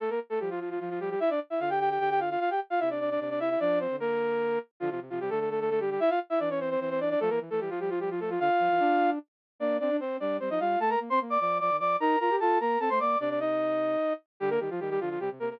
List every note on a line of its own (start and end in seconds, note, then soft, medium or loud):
0.00 0.10 A3 medium
0.00 0.10 A4 medium
0.10 0.19 A#3 medium
0.10 0.19 A#4 medium
0.30 0.39 A3 medium
0.30 0.39 A4 medium
0.40 0.77 F3 medium
0.40 0.49 G3 medium
0.40 0.49 G4 medium
0.50 0.59 F3 medium
0.50 0.59 F4 medium
0.60 0.69 F3 medium
0.60 0.69 F4 medium
0.70 0.79 F3 medium
0.70 0.79 F4 medium
0.80 0.89 F3 medium
0.80 1.15 F3 medium
0.80 0.89 F4 medium
0.90 0.99 F3 medium
0.90 0.99 F4 medium
1.00 1.09 G3 medium
1.00 1.09 G4 medium
1.10 1.20 G3 medium
1.10 1.20 G4 medium
1.20 1.30 E4 medium
1.20 1.30 E5 medium
1.30 1.40 D4 medium
1.30 1.40 D5 medium
1.50 1.60 E4 medium
1.50 1.60 E5 medium
1.60 1.98 D3 medium
1.60 1.69 F4 medium
1.60 1.69 F5 medium
1.70 1.79 G4 medium
1.70 1.79 G5 medium
1.80 1.89 G4 medium
1.80 1.89 G5 medium
1.90 1.99 G4 medium
1.90 1.99 G5 medium
1.99 2.37 D3 medium
1.99 2.09 G4 medium
1.99 2.09 G5 medium
2.10 2.20 G4 medium
2.10 2.20 G5 medium
2.20 2.29 F4 medium
2.20 2.29 F5 medium
2.30 2.40 F4 medium
2.30 2.40 F5 medium
2.40 2.50 F4 medium
2.40 2.50 F5 medium
2.50 2.60 G4 medium
2.50 2.60 G5 medium
2.70 2.80 F4 medium
2.70 2.80 F5 medium
2.80 3.18 C3 medium
2.80 2.89 E4 medium
2.80 2.89 E5 medium
2.90 3.00 D4 medium
2.90 3.00 D5 medium
3.00 3.10 D4 medium
3.00 3.10 D5 medium
3.10 3.20 D4 medium
3.10 3.20 D5 medium
3.20 3.56 C3 medium
3.20 3.29 D4 medium
3.20 3.29 D5 medium
3.30 3.39 D4 medium
3.30 3.39 D5 medium
3.40 3.49 E4 medium
3.40 3.49 E5 medium
3.50 3.59 E4 medium
3.50 3.59 E5 medium
3.60 3.87 F3 medium
3.60 3.79 D4 medium
3.60 3.79 D5 medium
3.80 3.96 C4 medium
3.80 3.96 C5 medium
3.90 4.58 D3 medium
4.00 4.59 A#3 medium
4.00 4.59 A#4 medium
4.80 4.90 D3 loud
4.80 4.89 F3 medium
4.80 4.89 F4 medium
4.90 5.00 C3 medium
4.90 5.00 F3 medium
4.90 5.00 F4 medium
5.00 5.10 C3 medium
5.10 5.20 C3 medium
5.10 5.19 F3 medium
5.10 5.19 F4 medium
5.20 5.30 C3 medium
5.20 5.30 G3 medium
5.20 5.30 G4 medium
5.30 5.98 D3 medium
5.30 5.39 A3 medium
5.30 5.39 A4 medium
5.40 5.49 A3 medium
5.40 5.49 A4 medium
5.50 5.60 A3 medium
5.50 5.60 A4 medium
5.60 5.70 A3 medium
5.60 5.70 A4 medium
5.70 5.79 A3 medium
5.70 5.79 A4 medium
5.80 5.90 G3 medium
5.80 5.90 G4 medium
5.90 6.00 G3 medium
5.90 6.00 G4 medium
6.00 6.10 E4 medium
6.00 6.10 E5 loud
6.10 6.19 F4 medium
6.10 6.19 F5 medium
6.30 6.39 E4 medium
6.30 6.39 E5 medium
6.40 6.76 E3 medium
6.40 6.49 D4 medium
6.40 6.49 D5 medium
6.50 6.59 C#4 medium
6.50 6.59 C#5 medium
6.60 6.70 C4 medium
6.60 6.70 C5 medium
6.70 6.80 C4 medium
6.70 6.80 C5 medium
6.80 7.15 E3 medium
6.80 6.90 C4 medium
6.80 6.90 C5 medium
6.90 7.00 C4 medium
6.90 7.00 C5 medium
7.00 7.09 D4 medium
7.00 7.09 D5 medium
7.10 7.19 D4 medium
7.10 7.19 D5 medium
7.20 7.30 F3 loud
7.20 7.30 A3 medium
7.20 7.30 A4 loud
7.30 7.40 E3 medium
7.30 7.39 A#3 medium
7.30 7.39 A#4 medium
7.40 7.50 E3 medium
7.50 7.60 E3 medium
7.50 7.60 A3 medium
7.50 7.60 A4 medium
7.60 7.70 E3 medium
7.60 7.70 G3 medium
7.60 7.70 G4 medium
7.70 8.37 F3 medium
7.70 7.79 F3 medium
7.70 7.79 F4 medium
7.80 7.90 G3 medium
7.80 7.90 G4 medium
7.90 7.99 F3 medium
7.90 7.99 F4 medium
8.00 8.09 G3 medium
8.00 8.09 G4 medium
8.10 8.20 F3 medium
8.10 8.20 F4 medium
8.20 8.30 A3 medium
8.20 8.30 A4 medium
8.30 8.39 F3 medium
8.30 8.39 F4 medium
8.40 8.49 D3 loud
8.40 9.10 F4 medium
8.40 9.10 F5 medium
8.59 8.69 F3 medium
8.70 8.80 E3 medium
8.80 9.19 D4 medium
9.60 9.79 A#3 medium
9.60 9.77 D4 medium
9.60 9.77 D5 medium
9.80 9.90 C4 medium
9.80 9.96 D4 medium
9.80 9.96 D5 medium
9.90 10.00 D4 medium
10.00 10.18 C4 medium
10.00 10.17 C4 medium
10.00 10.17 C5 medium
10.20 10.39 G3 medium
10.20 10.37 D4 medium
10.20 10.37 D5 medium
10.40 10.50 G3 medium
10.40 10.49 C4 medium
10.40 10.49 C5 medium
10.50 10.59 F3 medium
10.50 10.60 D#4 medium
10.50 10.60 D#5 medium
10.60 10.76 G3 medium
10.60 10.79 F4 medium
10.60 10.79 F5 medium
10.79 10.96 A3 medium
10.79 10.90 A4 medium
10.79 10.90 A5 medium
10.90 10.99 A#4 medium
10.90 10.99 A#5 medium
11.00 11.09 A#3 medium
11.10 11.20 C4 medium
11.10 11.19 C5 medium
11.10 11.19 C6 medium
11.21 11.38 A#3 medium
11.30 11.40 D5 medium
11.30 11.40 D6 medium
11.40 11.60 F3 medium
11.40 11.58 D5 medium
11.40 11.58 D6 medium
11.60 11.70 F3 medium
11.60 11.77 D5 medium
11.60 11.77 D6 medium
11.70 11.80 D#3 medium
11.79 11.96 F3 medium
11.79 11.96 D5 medium
11.79 11.96 D6 medium
12.00 12.16 D#4 loud
12.00 12.19 A#4 medium
12.00 12.19 A#5 medium
12.20 12.30 F4 medium
12.20 12.36 A#4 medium
12.20 12.36 A#5 medium
12.30 12.40 G4 medium
12.40 12.59 F4 medium
12.40 12.59 A4 medium
12.40 12.59 A5 medium
12.60 12.77 A#3 medium
12.60 12.79 A#4 medium
12.60 12.79 A#5 medium
12.80 12.89 C4 medium
12.80 12.89 A4 medium
12.80 12.89 A5 medium
12.90 13.00 A3 medium
12.90 12.99 C5 medium
12.90 12.99 C6 medium
13.00 13.16 A#3 medium
13.00 13.18 D5 medium
13.00 13.18 D6 medium
13.20 13.96 C3 medium
13.20 13.29 D4 medium
13.20 13.29 D5 medium
13.30 13.39 D4 medium
13.30 13.39 D5 medium
13.40 14.13 D#4 medium
13.40 14.13 D#5 medium
14.40 14.58 D3 loud
14.40 14.50 G3 medium
14.40 14.50 G4 loud
14.50 14.59 A#3 medium
14.50 14.59 A#4 medium
14.60 14.69 D#3 medium
14.60 14.70 G3 medium
14.60 14.70 G4 medium
14.70 14.80 F3 medium
14.70 14.80 F4 medium
14.80 14.98 D#3 medium
14.80 14.89 G3 medium
14.80 14.89 G4 medium
14.90 15.00 G3 medium
14.90 15.00 G4 medium
15.00 15.18 D3 medium
15.00 15.09 F3 medium
15.00 15.09 F4 medium
15.10 15.19 F3 medium
15.10 15.19 F4 medium
15.20 15.29 C3 medium
15.20 15.30 G3 medium
15.20 15.30 G4 medium
15.31 15.39 C3 medium
15.40 15.58 C3 medium
15.40 15.49 A#3 medium
15.40 15.49 A#4 medium
15.50 15.60 A#3 medium
15.50 15.60 A#4 medium